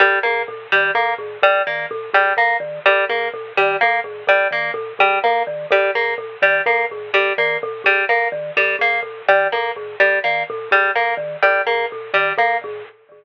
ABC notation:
X:1
M:3/4
L:1/8
Q:1/4=126
K:none
V:1 name="Marimba" clef=bass
^A,, =A,, ^A,, ^D, A,, =A,, | ^A,, ^D, A,, =A,, ^A,, D, | ^A,, =A,, ^A,, ^D, A,, =A,, | ^A,, ^D, A,, =A,, ^A,, D, |
^A,, =A,, ^A,, ^D, A,, =A,, | ^A,, ^D, A,, =A,, ^A,, D, | ^A,, =A,, ^A,, ^D, A,, =A,, | ^A,, ^D, A,, =A,, ^A,, D, |
^A,, =A,, ^A,, ^D, A,, =A,, |]
V:2 name="Orchestral Harp"
G, ^A, z G, A, z | G, ^A, z G, A, z | G, ^A, z G, A, z | G, ^A, z G, A, z |
G, ^A, z G, A, z | G, ^A, z G, A, z | G, ^A, z G, A, z | G, ^A, z G, A, z |
G, ^A, z G, A, z |]